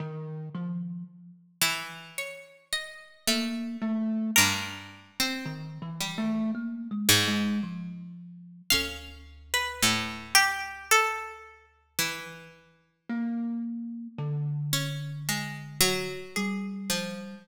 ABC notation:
X:1
M:4/4
L:1/16
Q:1/4=55
K:none
V:1 name="Pizzicato Strings"
z8 ^c2 ^d6 | ^A16 | f3 B3 G2 A3 z5 | z12 ^G4 |]
V:2 name="Pizzicato Strings"
z6 E,6 A,4 | G,,3 C3 G,4 ^G,,2 z4 | ^C4 A,,8 E,4 | z6 ^C2 ^G,2 ^F,4 =F,2 |]
V:3 name="Kalimba"
^D,2 F,2 z8 ^A,2 =A,2 | z4 (3^D,2 E,2 A,2 (3^A,2 ^G,2 G,2 F,4 | D,,16 | ^A,4 D,8 G,4 |]